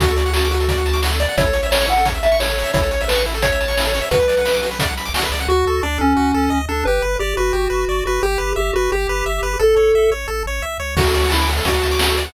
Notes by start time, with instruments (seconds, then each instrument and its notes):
0.00 synth bass 1 D2, lead 1 (square) F#4, kick, closed hi-hat
0.08 lead 1 (square) A4, closed hi-hat
0.16 lead 1 (square) D5, closed hi-hat
0.26 lead 1 (square) F#5, closed hi-hat
0.33 lead 1 (square) F#4 A5, snare
0.43 lead 1 (square) D6, closed hi-hat
0.51 lead 1 (square) F#4, closed hi-hat
0.60 lead 1 (square) A4, closed hi-hat
0.68 lead 1 (square) D5, kick, closed hi-hat
0.77 lead 1 (square) F#5, closed hi-hat
0.86 lead 1 (square) A5, closed hi-hat
0.93 lead 1 (square) D6, snare, closed hi-hat
1.02 lead 1 (square) F#4, snare
1.12 lead 1 (square) A4, closed hi-hat
1.20 lead 1 (square) D5, closed hi-hat
1.29 lead 1 (square) F#5, closed hi-hat
1.37 synth bass 1 A1, lead 1 (square) E4 C#5, kick, closed hi-hat
1.46 lead 1 (square) A4, closed hi-hat
1.53 lead 1 (square) C#5, closed hi-hat
1.63 lead 1 (square) E5, closed hi-hat
1.71 lead 1 (square) C#5 A5, snare
1.79 lead 1 (square) C#6, closed hi-hat
1.87 lead 1 (square) E4 F#5, closed hi-hat
1.96 lead 1 (square) A4, closed hi-hat
2.05 lead 1 (square) C#5, kick, closed hi-hat
2.14 lead 1 (square) E5, closed hi-hat
2.23 lead 1 (square) E5 A5, closed hi-hat
2.31 lead 1 (square) C#6, snare, closed hi-hat
2.39 lead 1 (square) E4 C#5, snare
2.48 lead 1 (square) A4, closed hi-hat
2.58 lead 1 (square) C#5, closed hi-hat
2.64 lead 1 (square) E5, closed hi-hat
2.73 synth bass 1 A1, lead 1 (square) E4 C#5, kick, closed hi-hat
2.82 lead 1 (square) A4, closed hi-hat
2.91 lead 1 (square) C#5, closed hi-hat
3.00 lead 1 (square) E5, closed hi-hat
3.08 lead 1 (square) B4 A5, snare
3.15 lead 1 (square) C#6, closed hi-hat
3.26 lead 1 (square) E4, closed hi-hat
3.34 lead 1 (square) A4, closed hi-hat
3.42 lead 1 (square) C#5, kick, closed hi-hat
3.52 lead 1 (square) E5, closed hi-hat
3.61 lead 1 (square) A5, closed hi-hat
3.68 lead 1 (square) C#6, snare, closed hi-hat
3.77 lead 1 (square) E4, snare
3.84 lead 1 (square) A4, closed hi-hat
3.94 lead 1 (square) C#5, closed hi-hat
4.01 lead 1 (square) E5, closed hi-hat
4.11 synth bass 1 B1, lead 1 (square) F#4 B4, kick, closed hi-hat
4.19 lead 1 (square) B4, closed hi-hat
4.28 lead 1 (square) D5, closed hi-hat
4.37 lead 1 (square) F#5, closed hi-hat
4.45 lead 1 (square) B5, snare
4.53 lead 1 (square) D6, closed hi-hat
4.62 lead 1 (square) F#4, closed hi-hat
4.71 lead 1 (square) B4, closed hi-hat
4.79 lead 1 (square) D5, kick, closed hi-hat
4.87 lead 1 (square) F#5, closed hi-hat
4.97 lead 1 (square) B5, closed hi-hat
5.05 lead 1 (square) D6, snare, closed hi-hat
5.14 synth bass 1 C2, lead 1 (square) F#4, snare
5.22 lead 1 (square) B4, closed hi-hat
5.32 synth bass 1 C#2, lead 1 (square) D5, closed hi-hat
5.39 lead 1 (square) F#5, closed hi-hat
5.48 synth bass 1 D2, lead 1 (square) F#4
5.66 synth bass 1 D2, lead 1 (square) A4
5.83 synth bass 1 D2, lead 1 (square) D4 D5
5.98 synth bass 1 D2, lead 1 (square) C#4 A4
6.16 synth bass 1 D2, lead 1 (square) F#4
6.34 synth bass 1 D2, lead 1 (square) A4
6.50 synth bass 1 D2, lead 1 (square) D#5
6.68 synth bass 1 D2, lead 1 (square) D4 A4
6.85 synth bass 1 G1, lead 1 (square) G4 B4
7.02 synth bass 1 G1, lead 1 (square) B4
7.19 synth bass 1 G1, lead 1 (square) G4 D5
7.37 synth bass 1 G1, lead 1 (square) F#4 B4
7.53 synth bass 1 G1, lead 1 (square) G4
7.70 synth bass 1 G1, lead 1 (square) B4
7.88 synth bass 1 G1, lead 1 (square) D5
8.05 synth bass 1 G1, lead 1 (square) F#4 B4
8.23 synth bass 1 G1, lead 1 (square) G4
8.38 synth bass 1 G1, lead 1 (square) B4
8.56 synth bass 1 G1, lead 1 (square) G4 E5
8.73 synth bass 1 G1, lead 1 (square) F#4 B4
8.92 synth bass 1 G1, lead 1 (square) G4
9.09 synth bass 1 G1, lead 1 (square) B4
9.26 synth bass 1 G1, lead 1 (square) E5
9.42 synth bass 1 G1, lead 1 (square) B4
9.59 synth bass 1 A1, lead 1 (square) A4
9.76 synth bass 1 A1, lead 1 (square) C#5
9.94 synth bass 1 A1, lead 1 (square) E5
10.11 synth bass 1 A1, lead 1 (square) C#5
10.28 synth bass 1 A1, lead 1 (square) A4
10.46 synth bass 1 A1, lead 1 (square) C#5
10.62 synth bass 1 C2, lead 1 (square) E5
10.80 synth bass 1 C#2, lead 1 (square) C#5
10.97 synth bass 1 D2, lead 1 (square) F#4, kick, crash
11.05 lead 1 (square) A4, closed hi-hat
11.14 lead 1 (square) D5, closed hi-hat
11.22 lead 1 (square) F#5, closed hi-hat
11.29 lead 1 (square) E4 A5, snare
11.40 lead 1 (square) D6, closed hi-hat
11.47 lead 1 (square) F#4, closed hi-hat
11.57 lead 1 (square) A4, closed hi-hat
11.65 synth bass 1 D2, lead 1 (square) F#4 D5, kick, closed hi-hat
11.74 lead 1 (square) F#5, closed hi-hat
11.81 lead 1 (square) A5, closed hi-hat
11.91 lead 1 (square) D6, snare, closed hi-hat
11.99 lead 1 (square) F#4, snare
12.09 lead 1 (square) A4, closed hi-hat
12.17 lead 1 (square) D5, closed hi-hat
12.25 lead 1 (square) F#5, closed hi-hat